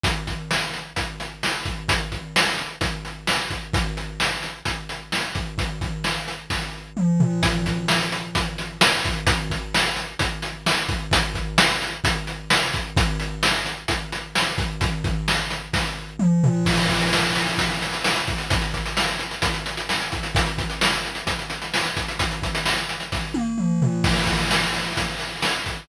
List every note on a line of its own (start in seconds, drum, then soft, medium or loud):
0.03 kick medium
0.03 closed hi-hat medium
0.27 kick medium
0.27 closed hi-hat medium
0.51 snare medium
0.74 closed hi-hat medium
0.96 kick medium
0.96 closed hi-hat medium
1.20 closed hi-hat medium
1.43 snare medium
1.65 kick medium
1.65 closed hi-hat medium
1.88 kick medium
1.88 closed hi-hat loud
2.12 kick medium
2.12 closed hi-hat medium
2.36 snare loud
2.58 closed hi-hat medium
2.81 kick medium
2.81 closed hi-hat medium
3.05 closed hi-hat medium
3.27 snare medium
3.50 kick medium
3.50 closed hi-hat medium
3.73 kick loud
3.73 closed hi-hat medium
3.97 closed hi-hat medium
4.20 snare medium
4.43 closed hi-hat medium
4.65 kick medium
4.65 closed hi-hat medium
4.89 closed hi-hat medium
5.12 snare medium
5.35 kick medium
5.35 closed hi-hat medium
5.58 kick medium
5.58 closed hi-hat medium
5.81 kick medium
5.81 closed hi-hat medium
6.04 snare medium
6.28 closed hi-hat medium
6.50 kick medium
6.50 snare medium
6.97 mid tom medium
7.20 floor tom loud
7.43 kick medium
7.43 closed hi-hat loud
7.66 kick medium
7.66 closed hi-hat medium
7.88 snare loud
8.12 closed hi-hat medium
8.35 kick medium
8.35 closed hi-hat medium
8.58 closed hi-hat medium
8.81 snare loud
9.04 kick medium
9.04 closed hi-hat medium
9.27 kick loud
9.27 closed hi-hat loud
9.50 kick medium
9.50 closed hi-hat medium
9.74 snare loud
9.96 closed hi-hat medium
10.19 kick medium
10.19 closed hi-hat medium
10.42 closed hi-hat medium
10.66 snare loud
10.89 kick medium
10.89 closed hi-hat medium
11.11 kick medium
11.11 closed hi-hat loud
11.34 kick medium
11.34 closed hi-hat medium
11.58 snare loud
11.82 closed hi-hat medium
12.04 kick medium
12.04 closed hi-hat loud
12.27 closed hi-hat medium
12.50 snare loud
12.73 kick medium
12.73 closed hi-hat medium
12.97 kick loud
12.97 closed hi-hat medium
13.20 closed hi-hat medium
13.43 snare loud
13.66 closed hi-hat medium
13.88 kick medium
13.88 closed hi-hat medium
14.12 closed hi-hat medium
14.35 snare medium
14.58 kick medium
14.58 closed hi-hat medium
14.81 kick medium
14.81 closed hi-hat medium
15.04 kick medium
15.04 closed hi-hat medium
15.28 snare medium
15.50 closed hi-hat medium
15.73 kick medium
15.73 snare medium
16.19 mid tom medium
16.44 floor tom loud
16.65 kick medium
16.65 crash loud
16.77 closed hi-hat medium
16.89 kick medium
16.89 closed hi-hat medium
17.01 closed hi-hat medium
17.13 snare medium
17.24 closed hi-hat medium
17.35 closed hi-hat medium
17.47 closed hi-hat medium
17.58 kick medium
17.58 closed hi-hat medium
17.70 closed hi-hat medium
17.82 closed hi-hat medium
17.93 closed hi-hat medium
18.04 snare medium
18.15 closed hi-hat medium
18.27 kick medium
18.27 closed hi-hat medium
18.38 closed hi-hat medium
18.50 kick medium
18.50 closed hi-hat medium
18.61 closed hi-hat medium
18.74 kick medium
18.74 closed hi-hat medium
18.86 closed hi-hat medium
18.97 snare medium
19.08 closed hi-hat medium
19.19 closed hi-hat medium
19.31 closed hi-hat medium
19.42 kick medium
19.42 closed hi-hat medium
19.54 closed hi-hat medium
19.66 closed hi-hat medium
19.77 closed hi-hat medium
19.89 snare medium
20.01 closed hi-hat medium
20.12 kick medium
20.12 closed hi-hat medium
20.23 closed hi-hat medium
20.35 kick loud
20.35 closed hi-hat loud
20.46 closed hi-hat medium
20.58 kick medium
20.58 closed hi-hat medium
20.70 closed hi-hat medium
20.81 snare loud
20.93 closed hi-hat medium
21.05 closed hi-hat medium
21.15 closed hi-hat medium
21.27 kick medium
21.27 closed hi-hat medium
21.39 closed hi-hat medium
21.50 closed hi-hat medium
21.62 closed hi-hat medium
21.74 snare medium
21.84 closed hi-hat medium
21.97 kick medium
21.97 closed hi-hat medium
22.08 closed hi-hat medium
22.19 kick medium
22.19 closed hi-hat medium
22.31 closed hi-hat medium
22.42 kick medium
22.42 closed hi-hat medium
22.55 closed hi-hat medium
22.65 snare medium
22.77 closed hi-hat medium
22.89 closed hi-hat medium
23.00 closed hi-hat medium
23.12 kick medium
23.12 snare medium
23.34 high tom medium
23.58 mid tom medium
23.82 floor tom medium
24.04 kick loud
24.04 crash medium
24.27 kick medium
24.27 closed hi-hat medium
24.51 snare medium
24.74 closed hi-hat medium
24.97 kick medium
24.97 closed hi-hat medium
25.20 closed hi-hat medium
25.42 snare medium
25.66 kick medium
25.66 closed hi-hat medium